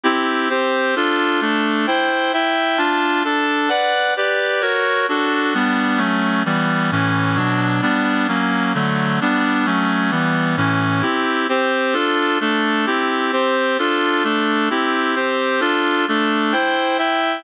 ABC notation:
X:1
M:6/8
L:1/8
Q:3/8=131
K:C
V:1 name="Clarinet"
[CEG]3 [CGc]3 | [DFA]3 [A,DA]3 | [Ecg]3 [Eeg]3 | [DFa]3 [DAa]3 |
[K:Bm] [Bdf]3 [GBd]3 | [F^Ac]3 [DF=A]3 | [G,B,D]3 [F,A,C]3 | [E,G,B,]3 [A,,E,C]3 |
[B,,F,D]3 [G,B,D]3 | [F,^A,C]3 [D,F,=A,]3 | [G,B,D]3 [F,A,C]3 | [E,G,B,]3 [A,,E,C]3 |
[K:C] [CEG]3 [CGc]3 | [DFA]3 [A,DA]3 | [CEG]3 [CGc]3 | [DFA]3 [A,DA]3 |
[CEG]3 [CGc]3 | [DFA]3 [A,DA]3 | [Ecg]3 [Eeg]3 |]